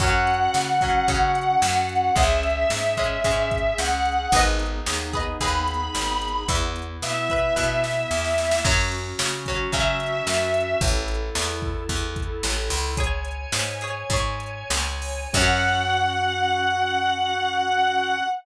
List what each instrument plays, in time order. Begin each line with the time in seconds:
0.00 electric bass (finger) F#2, acoustic guitar (steel) F#3 C#4, drawbar organ C#4 F#4, distortion guitar F#5, kick, closed hi-hat
0.27 closed hi-hat
0.54 electric bass (finger) C#3, snare
0.81 acoustic guitar (steel) F#3 C#4, kick, closed hi-hat
1.08 electric bass (finger) C#3, acoustic guitar (steel) F#3 C#4, kick, closed hi-hat
1.35 closed hi-hat
1.62 electric bass (finger) F#2, snare
1.89 closed hi-hat
2.16 electric bass (finger) C#2, acoustic guitar (steel) G#3 C#4, drawbar organ C#4 G#4, distortion guitar E5, kick, closed hi-hat
2.43 closed hi-hat
2.70 electric bass (finger) G#2, snare
2.97 acoustic guitar (steel) G#3 C#4, kick, closed hi-hat
3.24 electric bass (finger) G#2, acoustic guitar (steel) G#3 C#4, kick, closed hi-hat
3.51 kick, closed hi-hat
3.78 electric bass (finger) C#2, distortion guitar F#5, snare
4.05 closed hi-hat
4.32 electric bass (finger) G#1, drawbar organ B3 D#4 G#4, acoustic guitar (steel) G#4 B4, kick, closed hi-hat
4.36 acoustic guitar (steel) D#5
4.59 closed hi-hat
4.86 electric bass (finger) D#2, snare
5.13 acoustic guitar (steel) G#4 B4 D#5, kick, closed hi-hat
5.41 electric bass (finger) D#2, acoustic guitar (steel) G#4 B4 D#5, distortion guitar B5, kick, closed hi-hat
5.68 closed hi-hat
5.95 electric bass (finger) G#1, snare
6.22 closed hi-hat
6.48 electric bass (finger) E2, drawbar organ B3 E4, acoustic guitar (steel) B4 E5, kick, closed hi-hat
6.76 closed hi-hat
7.02 electric bass (finger) B2, distortion guitar E5, snare
7.30 acoustic guitar (steel) B4 E5, kick, closed hi-hat
7.56 electric bass (finger) B2, acoustic guitar (steel) B4 E5, kick, snare
7.84 snare
8.11 electric bass (finger) E2, snare
8.24 snare
8.38 snare
8.51 snare
8.64 electric bass (finger) F#2, acoustic guitar (steel) F#3 C#4, drawbar organ C#4 F#4, kick, crash
8.92 closed hi-hat
9.19 electric bass (finger) C#3, snare
9.46 acoustic guitar (steel) F#3 C#4, kick, closed hi-hat
9.72 electric bass (finger) C#3, acoustic guitar (steel) F#3 C#4, distortion guitar E5, kick, closed hi-hat
10.00 closed hi-hat
10.27 electric bass (finger) F#2, snare
10.54 closed hi-hat
10.81 electric bass (finger) A1, drawbar organ E4 A4, kick, closed hi-hat
11.08 closed hi-hat
11.35 electric bass (finger) E2, snare
11.62 kick
11.89 electric bass (finger) E2, kick, closed hi-hat
12.16 kick, closed hi-hat
12.43 electric bass (finger) A1, snare
12.70 electric bass (finger) C#2, open hi-hat
12.97 acoustic guitar (steel) G#4 C#5, drawbar organ C#5 G#5, kick, closed hi-hat
13.25 closed hi-hat
13.52 electric bass (finger) G#2, snare
13.81 acoustic guitar (steel) G#4 C#5, closed hi-hat
14.10 electric bass (finger) G#2, acoustic guitar (steel) G#4 C#5, kick, closed hi-hat
14.40 closed hi-hat
14.70 electric bass (finger) C#2, snare
15.02 open hi-hat
15.33 electric bass (finger) F#2, acoustic guitar (steel) F#3 C#4, drawbar organ C#4 F#4, distortion guitar F#5, kick, crash